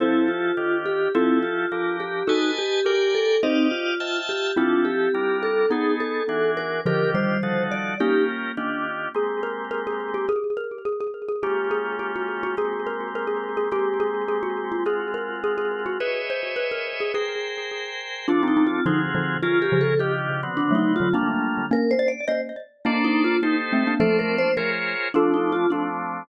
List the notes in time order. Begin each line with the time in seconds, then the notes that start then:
0.00 F3 C4 E4 G4 A4 C5
0.28 F4
0.57 D#3 D4 F4 G4
0.86 G4
1.14 F3 C4 E4 F4 G4 A4
1.43 F4
1.71 F3 D4 G4 A#4
2.00 G4
2.27 D#4 F#4 A4 B4 D#5 G#5 A5
2.59 G4
2.85 G4 A#4 D5 G5 G#5
3.15 A4
3.43 C4 D#4 G4 C5 D5 D#5 F5
3.71 F4
4.00 F4 E5 G5 A5
4.29 G4
4.56 F3 C4 D4 E4 F4 G4 A4
4.85 G4
5.14 G3 D4 F4 A#4
5.43 A4
5.70 B3 D#4 G#4 A4
6.00 A4
6.29 E3 D4 F#4 G#4
6.57 A#4
6.85 D3 D#3 F3 D4 F4 G4 A#4
7.14 D#3 G3 C5
7.43 F3 D#4 F#4 A4
7.71 D5
8.00 A#3 C#4 D#4 F4 G4 A#4
8.57 D#3 D4 F4 G4
9.14 G#3 A#3 C4 G4 G#4
9.43 A#4
9.71 A#4
9.87 G#4
10.14 G4
10.29 G#4
10.57 A#4
10.85 G#4
11.00 G#4
11.29 G#4
11.43 G#3 A#3 C#4 F4 G4
11.71 G#4
11.99 G4
12.16 F#4
12.43 F#4
12.57 G#3 A#3 C4 G4 G#4
12.87 A#4
13.15 A#4
13.27 G#4
13.57 G#4
13.71 G#3 A#3 C4 G4
14.00 G#4
14.28 G#4
14.43 F#4
14.72 F4
14.86 G#3 C4 F4 F#4 G#4
15.14 A#4
15.44 G#4
15.58 G#4
15.86 F#4
16.00 G#4 B4 C#5 D#5 E5
16.30 C5
16.56 B4
16.71 A#4
17.00 G#4
17.14 G#4 A#4 C5 G5
18.28 F3 C4 D4 F4 A4
18.43 C4 D#4
18.48 D#4
18.57 C4 D#4
18.67 F4
18.86 D3 F3 C4 D#4 F4 F#4 G#4
19.15 D3 F3
19.42 C#4 F4 G#4 A#4
19.62 G4
19.72 C#3 F3
19.81 A4
19.99 D#3 D4 F4 G4
20.43 D3 B3 C4 F#4
20.57 D4
20.71 F#3 A3
20.75 D#4
20.96 F4
21.00 D3 F#3
21.13 G3 A3 A#3 D4 F4
21.71 A#3 C#4 A#4
21.91 C5
21.99 D5
22.08 D5
22.28 C5 D#5
22.85 A#3 D4 A4 C5 D5
23.04 D#4
23.24 F4
23.43 D#4 G4 A4 C5
23.72 A3 C4
23.87 A#3 D4
24.00 F3 A3 F4 A4 C5 D5
24.19 A#4
24.38 C5
24.57 F4 G#4 A#4 C5 C#5
25.14 F3 A3 C4 D4 F4 A4
25.34 D#4
25.52 F4
25.70 F3 A3 C4 D4